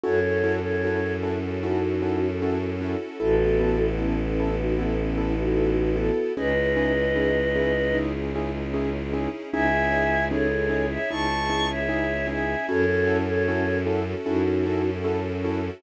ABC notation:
X:1
M:4/4
L:1/16
Q:1/4=76
K:C#m
V:1 name="Choir Aahs"
[Ac]3 [Ac]3 z2 [DF]4 z4 | [FA]4 [CE]3 [DF] [CE]3 [DF]3 [FA]2 | [Bd]10 z6 | [eg]4 [Ac]3 [ce] [ac']3 [ce]3 [eg]2 |
[Ac]3 [Ac]3 z2 [DF]4 z4 |]
V:2 name="Acoustic Grand Piano"
[CEFA]2 [CEFA]2 [CEFA]2 [CEFA]2 [CEFA]2 [CEFA]2 [CEFA]2 [CEFA]2 | [B,EA]2 [B,EA]2 [B,EA]2 [B,EA]2 [B,EA]2 [B,EA]2 [B,EA]2 [B,EA]2 | [CDEG]2 [CDEG]2 [CDEG]2 [CDEG]2 [CDEG]2 [CDEG]2 [CDEG]2 [CDEG]2 | [CDEG]2 [CDEG]2 [CDEG]2 [CDEG]2 [CDEG]2 [CDEG]2 [CDEG]2 [CDEG]2 |
[CEFA]2 [CEFA]2 [CEFA]2 [CEFA]2 [CEFA]2 [CEFA]2 [CEFA]2 [CEFA]2 |]
V:3 name="Violin" clef=bass
F,,16 | A,,,16 | C,,16 | C,,8 C,,8 |
F,,8 F,,8 |]
V:4 name="String Ensemble 1"
[CEFA]16 | [B,EA]16 | [CDEG]16 | [CDEG]16 |
[CEFA]16 |]